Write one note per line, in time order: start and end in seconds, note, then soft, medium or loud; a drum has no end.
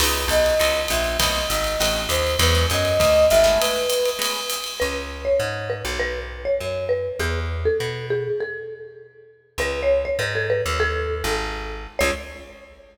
0.00 0.26 C#2 medium
0.00 0.21 B3 loud
0.00 0.21 C#4 loud
0.00 0.21 D#4 loud
0.00 0.21 E4 loud
0.00 0.29 B4 medium
0.00 crash medium
0.00 ride medium
0.28 0.55 B1 medium
0.28 0.80 D#5 medium
0.28 hi-hat pedal medium
0.28 ride medium
0.46 ride medium
0.59 0.87 C#2 medium
0.59 0.80 B3 medium
0.59 0.80 C#4 medium
0.59 0.80 D#4 medium
0.59 0.80 E4 loud
0.59 ride medium
0.88 1.17 A#1 medium
0.88 1.17 E5 medium
0.88 hi-hat pedal medium
0.88 ride medium
1.04 ride soft
1.19 1.46 B1 medium
1.19 1.40 A3 loud
1.19 1.40 B3 loud
1.19 1.40 C4 loud
1.19 1.40 D#4 loud
1.19 1.45 D#5 medium
1.19 kick soft
1.19 ride medium
1.49 1.77 G#1 medium
1.49 1.98 D#5 medium
1.49 hi-hat pedal medium
1.49 ride medium
1.64 ride medium
1.80 2.07 A1 medium
1.80 2.02 A3 medium
1.80 2.02 B3 medium
1.80 2.02 C4 medium
1.80 2.02 D#4 loud
1.80 ride medium
2.09 2.36 D#2 medium
2.09 2.37 C5 medium
2.09 hi-hat pedal medium
2.09 ride medium
2.27 ride medium
2.39 2.66 E2 loud
2.39 2.50 F#3 loud
2.39 2.50 G#3 loud
2.39 2.50 D4 loud
2.39 2.50 E4 loud
2.39 2.66 B4 medium
2.39 ride medium
2.55 2.76 F#3 loud
2.55 2.76 G#3 medium
2.55 2.76 D4 loud
2.55 2.76 E4 loud
2.70 2.98 F#2 medium
2.70 3.25 D#5 medium
2.70 hi-hat pedal medium
2.70 ride medium
2.85 ride medium
3.00 3.27 D2 medium
3.00 kick soft
3.00 ride medium
3.30 3.58 G#1 medium
3.30 3.57 E5 medium
3.30 hi-hat pedal medium
3.30 ride medium
3.44 3.80 G#3 loud
3.44 3.80 A3 loud
3.44 3.80 B3 loud
3.44 3.80 C#4 loud
3.44 ride medium
3.60 4.09 B4 medium
3.60 ride medium
3.89 hi-hat pedal medium
3.89 ride medium
4.05 ride medium
4.19 4.40 G#3 loud
4.19 4.40 A3 medium
4.19 4.40 B3 loud
4.19 4.40 C#4 medium
4.19 ride medium
4.50 hi-hat pedal medium
4.50 ride medium
4.64 ride medium
4.80 5.29 C#2 medium
4.80 4.98 B4 medium
5.25 5.68 C#5 medium
5.40 5.82 G#2 medium
5.70 5.99 B4 medium
5.85 6.48 B1 medium
6.00 6.19 B4 medium
6.45 6.84 C#5 medium
6.60 7.08 F#2 medium
6.89 7.15 B4 medium
7.19 7.67 E2 medium
7.19 7.40 G#4 medium
7.65 8.06 A4 medium
7.80 8.28 B2 medium
8.10 8.39 G#4 medium
8.40 8.80 A4 medium
9.58 10.06 C#2 medium
9.58 9.81 B4 medium
9.83 10.02 C#5 medium
10.05 10.19 C#5 medium
10.19 10.62 G#2 medium
10.19 10.34 B4 medium
10.35 10.47 A4 medium
10.50 10.62 B4 medium
10.66 11.23 D#2 medium
10.80 11.29 A4 loud
11.24 11.87 G#1 medium
11.99 12.11 C#2 loud
11.99 12.10 C#5 loud